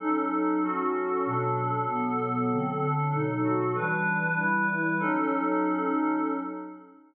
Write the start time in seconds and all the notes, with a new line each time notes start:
0.00 F#3 C#4 D#4 A4
0.63 F#3 C#4 F#4 A4
1.25 B2 F#3 D4 A4
1.87 B2 F#3 B3 A4
2.51 D3 F#3 C4 A4
2.81 D3 F#3 D4 A4
3.13 B2 F#3 D#4 A4
3.43 B2 F#3 F#4 A4
3.75 E3 G3 D4 B4
4.37 E3 G3 E4 B4
5.00 F#3 C#4 D#4 A4